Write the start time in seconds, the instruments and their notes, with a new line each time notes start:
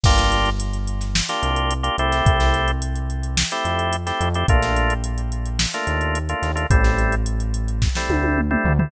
0.04 synth bass 1 G1, drawbar organ A#3 D4 F4 G4, kick, crash
0.18 snare, closed hi-hat
0.32 closed hi-hat
0.46 closed hi-hat
0.60 closed hi-hat
0.73 closed hi-hat
0.88 closed hi-hat
1.01 snare, closed hi-hat
1.15 snare
1.29 drawbar organ A#3 D4 F4 G4, snare, closed hi-hat
1.43 synth bass 1 C2, closed hi-hat
1.56 closed hi-hat
1.71 closed hi-hat
1.83 drawbar organ A#3 D4 F4 G4, closed hi-hat
1.98 synth bass 1 C2, drawbar organ A3 C4 E4 G4, closed hi-hat
2.12 snare, closed hi-hat
2.26 synth bass 1 C2, kick, closed hi-hat
2.40 snare, closed hi-hat
2.54 closed hi-hat
2.68 closed hi-hat
2.82 closed hi-hat
2.96 closed hi-hat
3.10 closed hi-hat
3.23 closed hi-hat
3.37 snare
3.51 drawbar organ A3 C4 E4 G4, closed hi-hat
3.65 synth bass 1 F2, closed hi-hat
3.79 closed hi-hat
3.93 closed hi-hat
4.06 drawbar organ A3 C4 E4 G4, snare, closed hi-hat
4.20 synth bass 1 F2, closed hi-hat
4.34 drawbar organ A3 C4 E4 G4, closed hi-hat
4.48 synth bass 1 A#1, drawbar organ A3 A#3 D4 F4, kick, closed hi-hat
4.63 snare, closed hi-hat
4.77 closed hi-hat
4.90 closed hi-hat
5.04 closed hi-hat
5.18 closed hi-hat
5.32 closed hi-hat
5.46 closed hi-hat
5.59 snare
5.74 drawbar organ A3 A#3 D4 F4, closed hi-hat
5.87 synth bass 1 D#2, closed hi-hat
6.01 closed hi-hat
6.15 closed hi-hat
6.29 drawbar organ A3 A#3 D4 F4, closed hi-hat
6.42 synth bass 1 D#2, snare, closed hi-hat
6.55 drawbar organ A3 A#3 D4 F4, closed hi-hat
6.70 synth bass 1 A1, drawbar organ G3 A3 C4 E4, kick, closed hi-hat
6.84 snare, closed hi-hat
6.98 closed hi-hat
7.12 closed hi-hat
7.26 closed hi-hat
7.40 closed hi-hat
7.54 closed hi-hat
7.68 closed hi-hat
7.82 kick, snare
7.95 drawbar organ G3 A3 C4 E4, snare
8.09 synth bass 1 D2, high tom
8.24 high tom
8.38 mid tom
8.51 drawbar organ G3 A3 C4 E4, mid tom
8.64 synth bass 1 D2, floor tom
8.79 drawbar organ G3 A3 C4 E4, floor tom